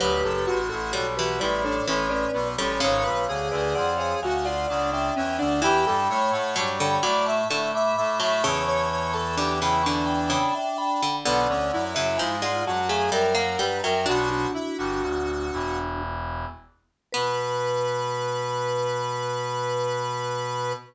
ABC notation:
X:1
M:3/4
L:1/16
Q:1/4=64
K:Bm
V:1 name="Vibraphone"
[GB]3 [FA] [Ac] [GB] [Bd] [Ac] [Ac] [Bd]2 [Ac] | [c^e]3 [Bd] [df] [ce] [e^g] [df] [df] [=e=g]2 [df] | [gb]3 [fa] [ac'] [gb] [bd'] [ac'] [ac'] [bd']2 [ac'] | [ac']3 [ac'] [bd'] [gb] [ac'] [gb] [gb] [eg] [gb]2 |
[df]3 [ce] [^e^g] [df] [fa] [eg] [=e=g] [f^a]2 [eg] | "^rit." [DF] [DF]7 z4 | B12 |]
V:2 name="Lead 1 (square)"
B A F3 F E D C C B, C | c B ^G3 G F ^E D D C D | G A c3 c d e e e e e | c c c A G E D6 |
B, C E3 ^E F ^G ^A A B A | "^rit." F F E F5 z4 | B12 |]
V:3 name="Harpsichord"
F,4 G, E, G,2 E, z2 G, | C,6 z6 | E,4 F, D, F,2 D, z2 F, | C,4 D, C, D,2 C, z2 D, |
D,3 C, ^E, ^G,2 A, =G, ^A, G, F, | "^rit." D12 | B,12 |]
V:4 name="Brass Section"
[D,,,D,,] [F,,,F,,] [A,,,A,,] [A,,,A,,] [B,,,B,,]2 [A,,,A,,]2 [A,,,A,,]2 [B,,,B,,] [A,,,A,,] | [^G,,,^G,,] [B,,,B,,] [D,,D,] [D,,D,] [^E,,^E,]2 [D,,D,]2 [C,,C,]2 [=E,,=E,] [D,,D,] | [E,,E,] [G,,G,] [A,,A,] [A,,A,] [G,,G,]2 [A,,A,]2 [A,,A,]2 [A,,A,] [A,,A,] | [E,,E,]10 z2 |
[B,,,B,,] [D,,D,] [F,,F,] [F,,F,] [^G,,^G,]2 [F,,F,]2 [F,,F,]2 [=G,,=G,] [F,,F,] | "^rit." [B,,,B,,]2 z [G,,,G,,] [D,,,D,,]2 [E,,,E,,]4 z2 | B,,12 |]